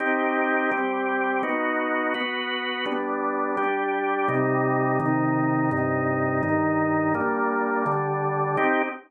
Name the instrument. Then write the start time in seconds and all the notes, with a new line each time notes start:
drawbar organ
0.00 C4 D#4 G4
0.71 G3 C4 G4
1.43 B3 D#4 F#4
2.14 B3 F#4 B4
2.86 G3 B3 D4
3.57 G3 D4 G4
4.28 C3 G3 D#4
5.00 C3 D#3 D#4
5.71 G2 C3 D#4
6.43 G2 D#3 D#4
7.14 G3 A#3 D4
7.86 D3 G3 D4
8.57 C4 D#4 G4